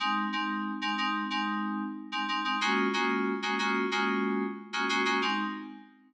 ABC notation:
X:1
M:4/4
L:1/16
Q:1/4=92
K:Abmix
V:1 name="Electric Piano 2"
[A,CE]2 [A,CE]3 [A,CE] [A,CE]2 [A,CE]5 [A,CE] [A,CE] [A,CE] | [A,B,DFG]2 [A,B,DFG]3 [A,B,DFG] [A,B,DFG]2 [A,B,DFG]5 [A,B,DFG] [A,B,DFG] [A,B,DFG] | [A,CE]4 z12 |]